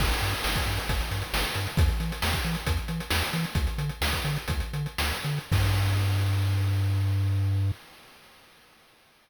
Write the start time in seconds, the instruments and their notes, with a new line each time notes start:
0.00 synth bass 1 G1, kick, crash
0.11 closed hi-hat
0.22 synth bass 1 G2, closed hi-hat
0.34 closed hi-hat
0.44 synth bass 1 G1, snare
0.56 kick, closed hi-hat
0.66 synth bass 1 G2, closed hi-hat
0.77 closed hi-hat
0.89 synth bass 1 G1, kick, closed hi-hat
1.01 closed hi-hat
1.11 synth bass 1 G2, closed hi-hat
1.22 closed hi-hat
1.33 synth bass 1 G1, snare
1.44 closed hi-hat
1.55 synth bass 1 G2, closed hi-hat
1.67 closed hi-hat
1.77 synth bass 1 E2, kick, closed hi-hat
1.88 closed hi-hat
2.00 synth bass 1 E3, closed hi-hat
2.12 closed hi-hat
2.22 synth bass 1 E2, snare
2.33 kick, closed hi-hat
2.44 synth bass 1 E3, closed hi-hat
2.55 closed hi-hat
2.67 synth bass 1 E2, kick, closed hi-hat
2.77 closed hi-hat
2.88 synth bass 1 E3, closed hi-hat
3.00 closed hi-hat
3.10 synth bass 1 E2, snare
3.21 closed hi-hat
3.33 synth bass 1 E3, closed hi-hat
3.44 closed hi-hat
3.55 synth bass 1 D2, kick, closed hi-hat
3.67 closed hi-hat
3.78 synth bass 1 D3, closed hi-hat
3.89 closed hi-hat
4.01 synth bass 1 D2, snare
4.12 kick, closed hi-hat
4.25 synth bass 1 D3, closed hi-hat
4.36 closed hi-hat
4.48 synth bass 1 D2, kick, closed hi-hat
4.60 closed hi-hat
4.73 synth bass 1 D3, closed hi-hat
4.86 closed hi-hat
4.98 synth bass 1 D2, snare
5.12 closed hi-hat
5.24 synth bass 1 D3, closed hi-hat
5.38 closed hi-hat
5.52 synth bass 1 G2, kick, crash